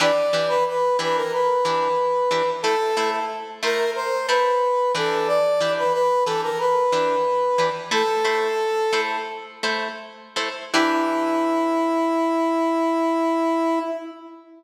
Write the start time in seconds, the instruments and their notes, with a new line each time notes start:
0.00 acoustic guitar (steel) E3 D4 G4 B4, brass section D5
0.33 acoustic guitar (steel) E3 D4 G4 B4
0.48 brass section B4
0.68 brass section B4
0.99 acoustic guitar (steel) E3 D4 G4 B4, brass section B4
1.16 brass section A#4
1.33 brass section B4
1.65 acoustic guitar (steel) E3 D4 G4 B4
2.31 acoustic guitar (steel) E3 D4 G4 B4
2.62 acoustic guitar (steel) A3 E4 C5, brass section A4
2.97 acoustic guitar (steel) A3 E4 C5
3.63 acoustic guitar (steel) A3 E4 C5, brass section A#4
3.95 brass section C5
4.28 acoustic guitar (steel) A3 E4 C5, brass section B4
4.95 acoustic guitar (steel) E3 D4 G4 B4, brass section A4
5.27 brass section D5
5.60 acoustic guitar (steel) E3 D4 G4 B4
5.78 brass section B4
5.93 brass section B4
6.25 acoustic guitar (steel) E3 D4 G4 B4, brass section A4
6.43 brass section A#4
6.59 brass section B4
6.92 acoustic guitar (steel) E3 D4 G4 B4
7.58 acoustic guitar (steel) E3 D4 G4 B4
7.91 acoustic guitar (steel) A3 E4 C5, brass section A4
8.24 acoustic guitar (steel) A3 E4 C5
8.93 acoustic guitar (steel) A3 E4 C5
9.63 acoustic guitar (steel) A3 E4 C5
10.36 acoustic guitar (steel) A3 E4 C5
10.73 acoustic guitar (steel) E3 D4 G4 B4, brass section E4